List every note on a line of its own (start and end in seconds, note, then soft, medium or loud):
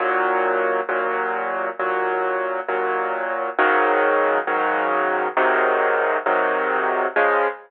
0.00 0.81 D#2 loud
0.00 0.81 A#2 loud
0.00 0.81 F#3 medium
0.89 1.69 D#2 medium
0.89 1.69 A#2 loud
0.89 1.69 F#3 medium
1.79 2.60 D#2 medium
1.79 2.60 A#2 medium
1.79 2.60 F#3 medium
2.68 3.49 D#2 medium
2.68 3.49 A#2 medium
2.68 3.49 F#3 medium
3.59 4.39 G#2 medium
3.59 4.39 C#3 loud
3.59 4.39 D#3 loud
3.59 4.39 F#3 loud
4.47 5.28 G#2 medium
4.47 5.28 C#3 medium
4.47 5.28 D#3 medium
4.47 5.28 F#3 medium
5.37 6.17 G#2 loud
5.37 6.17 C3 loud
5.37 6.17 D#3 loud
5.37 6.17 F#3 medium
6.26 7.07 G#2 medium
6.26 7.07 C3 medium
6.26 7.07 D#3 medium
6.26 7.07 F#3 medium
7.16 7.47 C#3 loud
7.16 7.47 F3 medium
7.16 7.47 G#3 loud